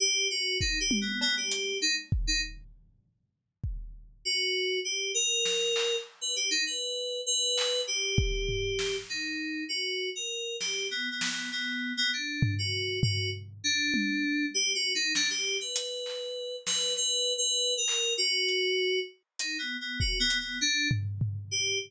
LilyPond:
<<
  \new Staff \with { instrumentName = "Electric Piano 2" } { \time 4/4 \tempo 4 = 99 g'8 ges'8 \tuplet 3/2 { ees'8 g'8 b8 } b16 g'8. ees'16 r8 ees'16 | r2. ges'4 | g'8 bes'4. r16 b'16 g'16 ees'16 b'4 | b'4 g'2 ees'4 |
ges'8. bes'8. g'8 \tuplet 3/2 { b8 b8 b8 } b8. b16 | d'8. ges'8. ges'8 r8 d'4. | \tuplet 3/2 { g'8 ges'8 ees'8 } d'16 g'8 b'4.~ b'16 b'8 | \tuplet 3/2 { b'4 b'4 bes'4 } ges'4. r8 |
\tuplet 3/2 { ees'8 b8 b8 ges'8 b8 b8 } d'8 r4 g'8 | }
  \new DrumStaff \with { instrumentName = "Drums" } \drummode { \time 4/4 r4 bd8 tommh8 cb8 hh8 r8 bd8 | r4 r4 bd4 r4 | r4 sn8 hc8 r4 r4 | r8 hc8 r8 bd8 tomfh8 sn8 r4 |
r4 r8 sn8 r8 sn8 r4 | r8 tomfh8 r8 tomfh8 r4 tommh4 | r4 sn4 hh8 hc8 r8 sn8 | r4 r8 hc8 r8 hh8 r4 |
hh4 bd8 hh8 r8 tomfh8 tomfh4 | }
>>